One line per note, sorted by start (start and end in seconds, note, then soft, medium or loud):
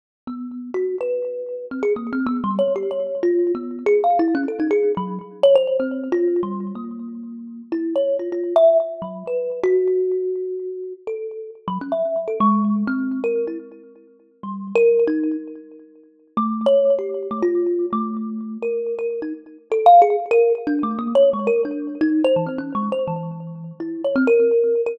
0.27 0.70 B3 medium
0.74 0.96 F#4 medium
1.01 1.65 B4 medium
1.71 1.82 C4 medium
1.83 1.94 G#4 medium
1.96 2.11 A#3 medium
2.13 2.27 C4 medium
2.27 2.41 B3 loud
2.44 2.58 G3 medium
2.59 2.73 C#5 medium
2.76 2.90 G4 medium
2.91 3.20 C#5 soft
3.23 3.52 F4 loud
3.55 3.84 B3 medium
3.86 4.01 G#4 loud
4.04 4.18 F5 medium
4.19 4.34 E4 loud
4.35 4.46 C#4 loud
4.48 4.59 A4 medium
4.60 4.70 D#4 medium
4.71 4.92 G#4 loud
4.97 5.19 F#3 loud
5.43 5.54 C#5 loud
5.55 5.77 C5 loud
5.80 6.08 C4 medium
6.12 6.41 F4 loud
6.43 6.72 G3 medium
6.75 7.62 A#3 medium
7.72 7.94 E4 medium
7.96 8.17 C#5 medium
8.19 8.30 F4 medium
8.32 8.54 F4 medium
8.56 8.78 E5 loud
9.02 9.23 F#3 medium
9.27 9.60 B4 medium
9.63 10.93 F#4 loud
11.07 11.50 A4 medium
11.68 11.79 F#3 loud
11.81 11.92 C#4 medium
11.92 12.24 E5 soft
12.28 12.38 A4 medium
12.40 12.84 G#3 loud
12.87 13.20 C4 medium
13.24 13.45 A#4 medium
13.47 13.58 E4 soft
14.43 14.72 G3 medium
14.75 15.04 A#4 loud
15.07 15.36 D#4 medium
16.37 16.66 A3 loud
16.66 16.95 C#5 medium
16.99 17.27 G4 medium
17.31 17.42 A3 medium
17.42 17.86 F4 loud
17.93 18.57 A3 medium
18.62 18.95 A#4 medium
18.99 19.20 A#4 medium
19.22 19.33 D#4 medium
19.72 19.86 A4 loud
19.86 20.00 F5 loud
20.02 20.16 G#4 loud
20.31 20.53 A#4 loud
20.67 20.81 D4 loud
20.83 20.98 A3 medium
20.99 21.13 A#3 medium
21.15 21.30 C#5 loud
21.33 21.48 G#3 medium
21.47 21.61 A#4 medium
21.65 21.97 D4 medium
22.01 22.23 D#4 loud
22.24 22.35 C5 loud
22.36 22.47 E3 medium
22.46 22.57 C4 soft
22.58 22.73 C#4 medium
22.75 22.89 G#3 medium
22.92 23.07 C5 medium
23.07 23.72 E3 medium
23.80 24.02 E4 medium
24.04 24.15 C#5 medium
24.16 24.26 C4 loud
24.27 24.81 A#4 loud
24.86 24.97 A#4 medium